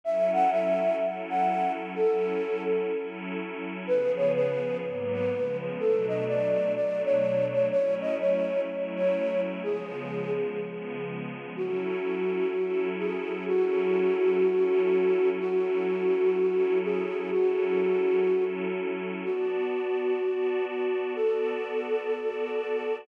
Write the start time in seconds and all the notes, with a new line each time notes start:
0.04 F#3 C#4 E4 A4 E5
0.33 F#5
0.51 E5
1.00 F#3 C#4 E4 A4
1.29 F#5
1.95 F#3 C#4 E4 A4
2.92 F#3 C#4 E4 A4
3.87 C#3 F3 B3 G#4 B4
4.17 C#5
4.35 B4
4.83 G#2 F#3 A#3 B3
5.13 B4
5.32 C#3 F3 G#3 B3
5.79 B2 F#3 A3 D4 A4
6.08 D#5
6.28 D5
6.76 B2 F#3 A3 D4 D5
7.04 C#5
7.53 C#5
7.71 F#3 A3 C#4 E4 C#5
8.01 D#5
8.20 C#5
8.68 F#3 A3 C#4 E4
8.96 C#5
9.64 C#3 F3 G#3 B3 G#4
10.60 C#3 F3 G#3 B3
11.55 F#3 C#4 E4 F#4 A4
12.52 F#3 C#4 E4 A4
12.99 G#4
13.48 F#3 C#4 E4 F#4 A4
14.44 F#3 C#4 E4 A4
15.39 F#3 C#4 E4 F#4 A4
16.36 F#3 C#4 E4 A4
16.84 G#4
17.32 F#3 C#4 E4 F#4 A4
18.27 F#3 C#4 E4 A4
19.23 B3 F#4 D5 A5
20.20 B3 F#4 D5 A5
20.67 F#4
21.16 B3 F#4 A4 D5 A5
22.12 B3 F#4 D5 A5